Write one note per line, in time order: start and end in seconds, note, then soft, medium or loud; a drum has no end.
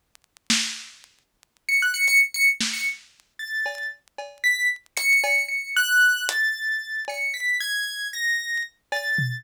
0.50 snare loud
1.69 1.80 C#7 medium
1.82 1.94 F#6 medium
1.94 2.06 C#7 loud
2.07 2.19 C#7 loud
2.07 closed hi-hat soft
2.34 2.46 C#7 loud
2.61 snare medium
2.73 2.85 C#7 medium
3.39 3.87 A6 medium
3.66 cowbell medium
4.18 cowbell medium
4.44 4.67 B6 medium
4.97 5.44 C#7 loud
4.97 closed hi-hat medium
5.24 cowbell loud
5.48 5.72 C#7 medium
5.77 6.24 F#6 loud
6.29 7.00 A6 medium
6.29 closed hi-hat loud
7.08 7.33 C#7 medium
7.08 cowbell medium
7.34 7.57 B6 medium
7.60 8.08 G#6 loud
8.13 8.61 A#6 medium
8.92 9.40 A6 medium
8.92 cowbell medium
9.18 floor tom medium